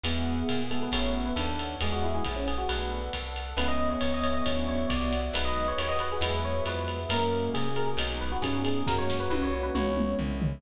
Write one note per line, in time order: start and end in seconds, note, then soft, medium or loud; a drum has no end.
0.04 0.43 E2 loud
0.04 0.35 G#3 medium
0.04 0.35 B3 medium
0.04 0.60 B3 loud
0.04 0.35 E4 medium
0.04 0.35 F#4 medium
0.04 0.48 G#4 medium
0.04 0.42 G#4 medium
0.04 0.48 B4 medium
0.04 0.48 E5 medium
0.04 0.48 F#5 medium
0.04 ride loud
0.48 0.89 A#2 medium
0.48 0.68 G#4 medium
0.48 0.92 G#4 medium
0.48 0.92 B4 medium
0.48 0.92 F#5 medium
0.48 0.92 G#5 medium
0.48 hi-hat pedal medium
0.48 ride medium
0.70 0.86 G#3 medium
0.70 0.86 B3 medium
0.70 1.35 B3 medium
0.70 0.86 E4 medium
0.70 0.86 F#4 medium
0.70 0.81 A4 medium
0.70 ride medium
0.83 0.93 B4 medium
0.92 1.32 A1 medium
0.92 1.24 A3 medium
0.92 1.24 C#4 medium
0.92 1.24 E4 loud
0.92 1.24 F#4 medium
0.92 1.36 A4 medium
0.92 1.36 C#5 medium
0.92 1.15 C#5 medium
0.92 1.36 E5 medium
0.92 1.36 F#5 medium
0.92 kick medium
0.92 ride loud
1.26 1.36 B4 medium
1.36 1.76 D#2 loud
1.36 1.76 D4 medium
1.36 1.57 A4 medium
1.36 1.80 A4 medium
1.36 1.80 C#5 medium
1.36 1.80 F#5 medium
1.36 1.80 A5 medium
1.36 hi-hat pedal medium
1.36 ride medium
1.59 ride medium
1.80 2.20 E2 medium
1.80 2.11 G#3 medium
1.80 2.23 G#3 loud
1.80 2.11 B3 medium
1.80 2.11 E4 medium
1.80 2.11 F#4 medium
1.80 2.25 G#4 medium
1.80 1.92 G#4 medium
1.80 2.25 B4 medium
1.80 2.25 E5 medium
1.80 2.25 F#5 medium
1.80 ride loud
1.92 2.03 F#4 medium
2.04 2.14 E4 medium
2.15 2.25 G#4 medium
2.25 2.65 A#1 medium
2.25 2.35 E4 medium
2.25 2.69 G#4 medium
2.25 2.69 B4 medium
2.25 2.69 F#5 medium
2.25 2.69 G#5 medium
2.25 kick medium
2.25 hi-hat pedal medium
2.25 ride medium
2.36 2.47 C#4 medium
2.48 2.58 G#4 medium
2.48 ride medium
2.58 2.68 F#4 medium
2.69 3.09 B1 medium
2.69 2.99 A3 medium
2.69 2.99 B3 medium
2.69 2.99 D4 medium
2.69 2.99 F#4 medium
2.69 3.13 A4 medium
2.69 3.08 B4 medium
2.69 3.13 B4 medium
2.69 3.13 D5 medium
2.69 3.13 F#5 medium
2.69 ride loud
3.13 3.54 C2 medium
3.13 3.57 A4 medium
3.13 3.57 B4 medium
3.13 3.57 F#5 medium
3.13 3.57 A5 medium
3.13 kick medium
3.13 hi-hat pedal medium
3.13 ride medium
3.36 ride medium
3.57 3.96 C#2 loud
3.57 3.88 G#3 medium
3.57 3.88 B3 medium
3.57 5.13 B3 medium
3.57 3.88 C#4 loud
3.57 3.88 E4 loud
3.57 4.01 G#4 medium
3.57 3.68 B4 medium
3.57 4.01 B4 medium
3.57 4.01 C#5 medium
3.57 4.01 E5 medium
3.57 ride loud
3.68 3.89 D#5 medium
3.90 4.00 C#5 medium
4.01 4.42 C#2 medium
4.01 4.45 G#4 medium
4.01 4.45 B4 medium
4.01 4.12 C#5 medium
4.01 4.45 E5 medium
4.01 4.45 G#5 medium
4.01 hi-hat pedal medium
4.01 ride loud
4.14 4.24 D#5 medium
4.23 4.34 C#5 medium
4.23 ride medium
4.34 4.45 D#5 medium
4.46 4.86 D2 medium
4.46 4.77 F#3 medium
4.46 4.77 C#4 medium
4.46 4.77 D4 medium
4.46 4.77 E4 loud
4.46 4.89 F#4 medium
4.46 4.89 C#5 medium
4.46 4.66 C#5 medium
4.46 4.89 D5 medium
4.46 4.89 E5 medium
4.46 kick medium
4.46 ride loud
4.68 4.87 C#5 medium
4.89 5.30 C2 medium
4.89 5.33 F#4 medium
4.89 5.33 C#5 medium
4.89 5.19 D5 medium
4.89 5.33 E5 medium
4.89 5.33 F#5 medium
4.89 kick medium
4.89 hi-hat pedal medium
4.89 ride loud
5.13 ride medium
5.33 5.73 B1 loud
5.33 5.66 F#3 medium
5.33 5.66 G#3 loud
5.33 5.66 B3 medium
5.33 5.66 D#4 medium
5.33 5.78 F#4 medium
5.33 5.78 G#4 medium
5.33 6.86 B4 medium
5.33 5.78 B4 medium
5.33 5.46 B4 medium
5.33 5.78 D#5 medium
5.33 ride loud
5.45 5.66 D#5 medium
5.68 5.78 C#5 medium
5.78 6.18 D#2 medium
5.78 6.22 F#4 medium
5.78 6.22 G#4 medium
5.78 5.90 C#5 medium
5.78 6.22 D#5 medium
5.78 6.22 F#5 medium
5.78 hi-hat pedal loud
5.78 ride loud
5.89 5.99 D#5 medium
5.99 6.10 B4 medium
5.99 ride medium
6.12 6.23 G#4 medium
6.21 6.61 E2 loud
6.21 6.53 F#3 medium
6.21 6.53 G#3 loud
6.21 6.53 B3 medium
6.21 6.53 E4 loud
6.21 6.66 F#4 medium
6.21 6.66 G#4 medium
6.21 6.66 B4 medium
6.21 6.43 B4 medium
6.21 6.66 E5 medium
6.21 ride loud
6.45 6.63 C#5 medium
6.65 7.06 F2 medium
6.65 6.97 F#3 medium
6.65 6.97 G#3 medium
6.65 6.97 B3 medium
6.65 6.97 E4 medium
6.65 7.10 E4 medium
6.65 7.10 F#4 medium
6.65 7.10 G#4 medium
6.65 6.98 B4 medium
6.65 7.10 E5 medium
6.65 hi-hat pedal loud
6.65 ride medium
6.88 ride medium
7.09 7.49 F#2 loud
7.09 7.41 F#3 medium
7.09 7.98 G#3 medium
7.09 7.41 G#3 medium
7.09 7.98 A#3 medium
7.09 7.41 A#3 medium
7.09 7.68 A#3 loud
7.09 7.98 C#4 medium
7.09 7.41 C#4 medium
7.09 7.98 F#4 medium
7.09 7.50 A#4 medium
7.09 ride loud
7.54 7.95 C3 medium
7.54 7.75 G#4 medium
7.54 hi-hat pedal loud
7.54 ride medium
7.76 7.87 A#4 medium
7.76 ride medium
7.87 7.98 G#4 medium
7.97 8.37 B1 loud
7.97 8.30 F#3 medium
7.97 8.86 G#3 medium
7.97 8.30 G#3 loud
7.97 8.86 B3 medium
7.97 8.30 B3 medium
7.97 8.86 D#4 medium
7.97 8.30 D#4 medium
7.97 8.86 F#4 medium
7.97 ride loud
8.21 8.31 B4 medium
8.32 8.42 F#4 medium
8.42 8.82 G2 medium
8.42 8.82 C#4 loud
8.42 8.61 G#4 medium
8.42 kick medium
8.42 hi-hat pedal medium
8.42 ride loud
8.65 8.86 G#4 medium
8.65 ride medium
8.87 9.27 F#2 loud
8.87 9.18 F#3 medium
8.87 9.74 G#3 medium
8.87 9.18 G#3 medium
8.87 9.74 A#3 medium
8.87 9.18 A#3 medium
8.87 9.74 C#4 medium
8.87 9.18 C#4 medium
8.87 9.74 F#4 medium
8.87 9.90 F#4 loud
8.87 8.98 A#4 medium
8.87 kick loud
8.87 snare medium
8.98 9.16 C#5 medium
9.10 snare medium
9.20 9.30 B4 medium
9.30 9.70 C2 loud
9.30 9.41 B4 medium
9.30 high tom loud
9.42 9.52 C#5 medium
9.53 9.63 C#5 medium
9.63 9.74 B4 medium
9.75 10.15 C#2 loud
9.75 10.07 E3 medium
9.75 10.62 G#3 medium
9.75 10.07 G#3 medium
9.75 10.62 B3 medium
9.75 10.07 B3 medium
9.75 10.62 C#4 medium
9.75 10.07 C#4 medium
9.75 10.62 E4 medium
9.75 10.15 C#5 medium
9.75 mid tom loud
9.97 mid tom loud
10.19 10.58 C2 medium
10.19 floor tom medium
10.41 10.56 E3 medium
10.41 10.56 G#3 medium
10.41 10.56 B3 medium
10.41 10.56 C#4 medium
10.41 floor tom loud